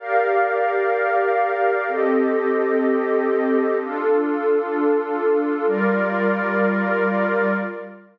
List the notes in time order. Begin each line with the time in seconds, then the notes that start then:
0.00 G4 A#4 D5 F5
1.88 C4 G4 A4 D#5
3.79 D4 F4 A4
5.66 G3 F4 A#4 D5